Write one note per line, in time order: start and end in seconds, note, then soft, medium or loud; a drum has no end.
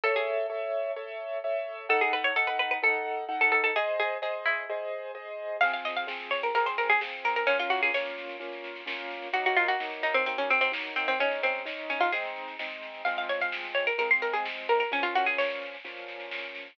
0.04 0.15 A4 loud
0.04 0.46 A4 loud
0.04 0.46 C#5 medium
0.04 0.46 E5 loud
0.16 1.14 G#4 loud
0.50 0.91 A4 medium
0.50 0.91 C#5 medium
0.50 0.91 E5 medium
0.96 1.38 A4 medium
0.96 1.38 C#5 medium
0.96 1.38 E5 medium
1.44 1.86 A4 medium
1.44 1.86 C#5 medium
1.44 1.86 E5 medium
1.89 2.31 D#4 loud
1.89 2.31 A4 loud
1.89 2.01 A4 loud
1.89 2.31 F#5 loud
2.01 2.12 G#4 loud
2.13 2.24 B4 loud
2.24 2.35 C#5 loud
2.36 2.78 D#4 loud
2.36 2.78 A4 medium
2.36 2.47 A4 loud
2.36 2.78 F#5 medium
2.47 2.58 B4 loud
2.59 2.70 B4 loud
2.71 2.82 B4 loud
2.82 3.24 D#4 loud
2.82 3.24 A4 medium
2.82 3.24 A4 loud
2.82 3.24 F#5 medium
3.28 3.70 D#4 loud
3.28 3.70 A4 medium
3.28 3.70 F#5 medium
3.41 3.51 A4 loud
3.52 3.63 A4 loud
3.64 3.75 A4 loud
3.76 4.18 G#4 loud
3.76 3.97 G#4 loud
3.76 4.18 C5 loud
3.76 4.18 D#5 loud
4.00 4.22 G#4 loud
4.22 4.64 G#4 medium
4.22 4.43 G#4 loud
4.22 4.64 C5 loud
4.22 4.64 D#5 medium
4.46 5.42 E4 loud
4.69 5.11 G#4 loud
4.69 5.11 C5 medium
4.69 5.11 D#5 medium
5.15 5.57 G#4 medium
5.15 5.57 C5 medium
5.15 5.57 D#5 medium
5.61 6.04 F3 loud
5.61 6.04 C4 loud
5.61 6.04 G#4 loud
5.61 5.72 F5 loud
5.61 kick loud
5.61 snare medium
5.73 5.84 F5 loud
5.73 snare medium
5.85 5.96 D#5 medium
5.85 snare medium
5.97 6.25 F5 loud
5.97 snare medium
6.07 6.49 F3 medium
6.07 6.49 C4 loud
6.07 6.49 G#4 medium
6.07 snare loud
6.20 snare medium
6.31 6.42 C#5 loud
6.31 snare medium
6.43 6.54 A#4 loud
6.43 snare medium
6.55 6.97 F3 medium
6.55 6.97 C4 medium
6.55 6.97 G#4 medium
6.55 6.66 A#4 loud
6.55 kick loud
6.55 snare medium
6.66 6.77 C5 loud
6.66 snare medium
6.78 6.89 A#4 loud
6.78 snare medium
6.90 7.01 G#4 loud
6.90 snare medium
7.01 7.43 F3 medium
7.01 7.43 C4 medium
7.01 7.43 G#4 medium
7.01 snare loud
7.13 snare medium
7.24 7.36 A#4 loud
7.24 snare medium
7.36 7.47 A#4 loud
7.36 snare medium
7.47 7.90 A#3 loud
7.47 7.58 C#4 loud
7.47 7.90 C#4 loud
7.47 7.90 F4 loud
7.47 kick loud
7.47 snare medium
7.59 7.71 F4 loud
7.59 snare medium
7.70 7.81 F#4 loud
7.70 snare medium
7.83 7.94 G#4 loud
7.83 snare medium
7.94 8.36 A#3 medium
7.94 8.36 C#4 medium
7.94 8.36 F4 medium
7.94 8.59 C#5 loud
7.94 snare loud
8.06 snare medium
8.17 snare medium
8.29 snare medium
8.40 8.82 A#3 medium
8.40 8.82 C#4 medium
8.40 8.82 F4 medium
8.40 kick medium
8.40 snare medium
8.52 snare medium
8.64 snare medium
8.76 snare medium
8.86 9.28 A#3 medium
8.86 9.28 C#4 medium
8.86 9.28 F4 medium
8.86 snare loud
8.99 snare medium
9.10 snare medium
9.22 snare medium
9.33 9.75 F#3 loud
9.33 9.75 A#3 loud
9.33 9.75 D#4 loud
9.33 9.44 F#4 loud
9.33 kick loud
9.33 snare medium
9.45 9.57 F#4 loud
9.45 snare medium
9.56 9.68 F4 loud
9.56 snare medium
9.68 9.97 F#4 loud
9.68 snare medium
9.80 10.22 F#3 medium
9.80 10.22 A#3 medium
9.80 10.22 D#4 medium
9.80 snare loud
9.92 snare medium
10.03 10.14 D#4 loud
10.03 snare medium
10.14 10.25 C4 loud
10.14 snare medium
10.26 10.68 F#3 medium
10.26 10.68 A#3 medium
10.26 10.37 C4 loud
10.26 10.68 D#4 medium
10.26 kick medium
10.26 snare medium
10.38 10.49 C#4 loud
10.38 snare medium
10.50 10.61 C4 loud
10.50 snare medium
10.61 10.72 C4 loud
10.61 snare medium
10.72 11.14 F#3 medium
10.72 11.14 A#3 medium
10.72 11.14 D#4 medium
10.72 snare loud
10.85 snare medium
10.96 11.07 C4 loud
10.96 snare medium
11.08 11.19 C4 loud
11.08 snare medium
11.19 11.61 G#3 loud
11.19 11.61 C#4 loud
11.19 11.40 C#4 loud
11.19 11.61 D#4 medium
11.19 kick loud
11.19 snare medium
11.31 snare medium
11.43 11.65 C4 loud
11.43 snare medium
11.55 snare medium
11.65 12.07 G#3 medium
11.65 12.07 C#4 medium
11.65 12.07 D#4 medium
11.65 snare loud
11.78 snare medium
11.90 12.01 C#4 medium
11.90 snare medium
12.00 12.12 F4 loud
12.00 snare medium
12.12 12.55 G#3 loud
12.12 12.55 C4 loud
12.12 12.55 D#4 loud
12.12 12.55 G#4 medium
12.12 kick medium
12.12 snare medium
12.24 snare medium
12.36 snare medium
12.48 snare medium
12.59 13.01 G#3 medium
12.59 13.01 C4 medium
12.59 13.01 D#4 medium
12.59 snare loud
12.71 snare medium
12.83 snare medium
12.94 snare medium
13.05 13.90 F3 loud
13.05 13.90 G#3 loud
13.05 13.90 C4 medium
13.05 13.16 F5 loud
13.05 kick loud
13.05 snare medium
13.17 13.29 F5 loud
13.17 snare medium
13.29 13.40 C#5 medium
13.29 snare medium
13.41 13.70 F5 loud
13.41 snare medium
13.52 snare loud
13.64 snare medium
13.75 13.86 C#5 loud
13.75 snare medium
13.87 13.98 A#4 loud
13.87 snare medium
13.98 14.82 F3 medium
13.98 14.82 G#3 loud
13.98 14.82 C4 medium
13.98 14.10 A#4 loud
13.98 kick medium
13.98 snare medium
14.10 14.22 C6 loud
14.10 snare medium
14.22 14.33 A#4 loud
14.22 snare medium
14.33 14.44 G#4 loud
14.33 snare medium
14.45 snare loud
14.57 snare medium
14.69 14.79 A#4 loud
14.69 snare medium
14.80 14.91 A#4 loud
14.80 snare medium
14.91 15.75 A#2 loud
14.91 15.75 F3 loud
14.91 15.75 C#4 loud
14.91 15.04 C#4 loud
14.91 kick loud
14.91 snare medium
15.03 15.14 F4 loud
15.03 snare medium
15.15 15.26 F#4 loud
15.15 snare medium
15.26 15.37 G#4 loud
15.26 snare medium
15.38 16.03 C#5 loud
15.38 snare loud
15.50 snare medium
15.62 snare medium
15.73 snare medium
15.84 16.68 A#2 medium
15.84 16.68 F3 medium
15.84 16.68 C#4 medium
15.84 kick medium
15.84 snare medium
15.97 snare medium
16.08 snare medium
16.20 snare medium
16.31 snare loud
16.43 snare medium
16.55 snare medium
16.66 snare medium